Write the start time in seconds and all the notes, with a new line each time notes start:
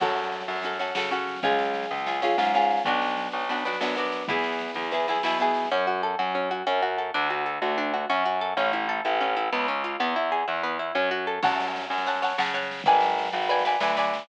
0.00 F#2 C#4 F#4 A4, kick, snare, crash
0.09 snare
0.16 snare
0.23 snare
0.32 snare
0.40 snare
0.48 F#2, snare
0.56 snare
0.62 C#4 F#4 A4, snare
0.73 snare
0.79 C#4 F#4 A4, snare
0.87 snare
0.95 C#3 C#4 F#4 A4, snare
1.03 snare
1.11 C#4 F#4 A4, snare
1.19 snare
1.27 snare
1.36 snare
1.43 C#2 C#4 F4 G#4, kick, snare
1.50 snare
1.58 snare
1.65 snare
1.74 snare
1.83 snare
1.91 C#2, snare
1.98 snare
2.06 C#4 F4 G#4, snare
2.14 snare
2.22 C#4 F4 G#4, snare
2.31 snare
2.38 G#2 C#4 F4 G#4, snare
2.44 snare
2.54 C#4 F4 G#4, snare
2.62 snare
2.70 snare
2.77 snare
2.84 B1 B3 D4 F#4, kick, snare
2.93 snare
3.02 snare
3.08 snare
3.17 snare
3.25 snare
3.32 B1, snare
3.41 snare
3.49 B3 D4 F#4, snare
3.58 snare
3.65 B3 D4 F#4, snare
3.73 snare
3.80 F#2 B3 D4 F#4, snare
3.88 snare
3.95 B3 D4 F#4, snare
4.05 snare
4.12 snare
4.21 snare
4.28 E2 B3 E4 G#4, kick, snare
4.38 snare
4.44 snare
4.52 snare
4.59 snare
4.68 snare
4.74 E2, snare
4.84 snare
4.91 B3 E4 G#4, snare
5.00 snare
5.08 B3 E4 G#4, snare
5.15 snare
5.23 B2 B3 E4 G#4, snare
5.32 snare
5.38 B3 E4 G#4, snare
5.47 snare
5.54 snare
5.65 snare
5.71 F#2 C#4
5.87 F#4
6.03 A4
6.19 F#2 F#4
6.35 C#4
6.51 F#4
6.67 F#2 C#4
6.82 F#4
6.98 A4
7.14 D2 D4
7.30 F#4
7.46 A4
7.62 D2 F#4
7.78 D4
7.94 F#4
8.10 F#2 C#4
8.26 F#4
8.41 A4
8.57 A1 C#4
8.73 E4
8.89 A4
9.05 A1 E4
9.21 C#4
9.37 E4
9.52 C#2 B3
9.68 C#4
9.84 F4
10.00 E2 B3
10.16 E4
10.32 G#4
10.48 E2 E4
10.63 B3
10.79 E4
10.95 F#2 C#4
11.11 F#4
11.27 A4
11.43 F#2 C#5 F#5 A5, kick, snare, crash
11.50 snare
11.60 snare
11.68 snare
11.76 snare
11.81 snare
11.90 F#2, snare
11.98 snare
12.06 C#5 F#5 A5, snare
12.15 snare
12.22 C#5 F#5 A5, snare
12.30 snare
12.38 C#3 C#5 F#5 A5, snare
12.46 snare
12.54 C#5 F#5 A5, snare
12.62 snare
12.71 snare
12.79 snare
12.84 G#1 B4 D5 G#5, kick, snare
12.94 snare
13.01 snare
13.10 snare
13.18 snare
13.25 snare
13.32 G#1, snare
13.42 snare
13.49 B4 D5 G#5, snare
13.59 snare
13.65 B4 D5 G#5, snare
13.72 snare
13.80 D2 B4 D5 G#5, snare
13.89 snare
13.97 B4 D5 G#5, snare
14.03 snare
14.14 snare
14.19 snare